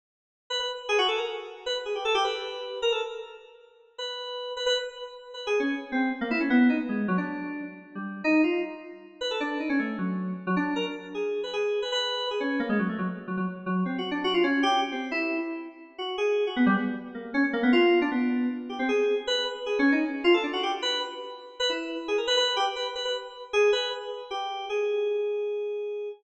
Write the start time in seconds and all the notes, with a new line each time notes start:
0.50 B4
0.60 B4
0.89 G#4
0.98 F#4
1.08 A4
1.18 A#4
1.66 B4
1.85 G#4
1.95 G4
2.05 A4
2.15 G4
2.24 B4
2.82 A#4
2.92 A4
3.98 B4
4.57 B4
4.66 B4
5.34 B4
5.47 G#4
5.60 C#4
5.92 C4
6.21 A#3
6.31 E4
6.40 C#4
6.50 B3
6.69 D#4
6.89 G#3
7.08 F#3
7.18 D4
7.95 G3
8.24 D#4
8.44 F4
9.21 B4
9.31 A4
9.40 D4
9.60 D#4
9.69 C#4
9.79 A3
9.98 F#3
10.47 F#3
10.56 D4
10.76 A#4
11.15 G#4
11.44 B4
11.53 G#4
11.82 B4
11.92 B4
12.31 G#4
12.40 C#4
12.60 A#3
12.69 G#3
12.79 F#3
12.89 A3
12.98 F#3
13.28 F#3
13.37 F#3
13.66 F#3
13.85 C4
13.98 F#4
14.11 D4
14.24 F#4
14.34 F4
14.44 C#4
14.63 G4
14.92 C4
15.11 E4
15.98 F#4
16.18 G#4
16.47 F#4
16.56 B3
16.66 G3
16.76 B3
17.15 A#3
17.34 C#4
17.53 A#3
17.63 B3
17.73 F4
18.02 D4
18.11 B3
18.69 G4
18.79 C4
18.89 G#4
19.27 B4
19.66 G#4
19.79 C#4
19.92 D#4
20.24 F4
20.34 A4
20.43 D4
20.53 F#4
20.63 G4
20.82 B4
21.60 B4
21.69 E4
22.08 G#4
22.18 A#4
22.27 B4
22.37 B4
22.56 G4
22.76 B4
22.95 B4
23.05 B4
23.53 G#4
23.73 B4
24.31 G4
24.69 G#4